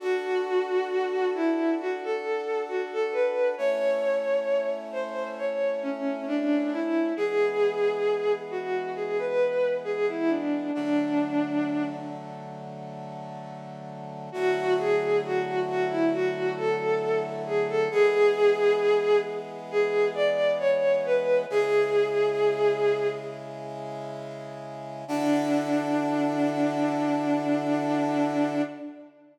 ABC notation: X:1
M:4/4
L:1/16
Q:1/4=67
K:Dlyd
V:1 name="Violin"
F6 E2 F A3 F A B2 | c6 ^B2 c2 C2 D2 E2 | G6 F2 G B3 G E D2 | D6 z10 |
F2 G2 F2 F E F2 A3 z G A | G6 z2 G2 d2 c2 B2 | G8 z8 | D16 |]
V:2 name="Brass Section"
[DFA]16 | [A,CE]16 | [E,G,B,]16 | [D,F,A,]16 |
[D,F,A,E]16 | [E,G,B,]16 | [C,G,E]16 | [D,EFA]16 |]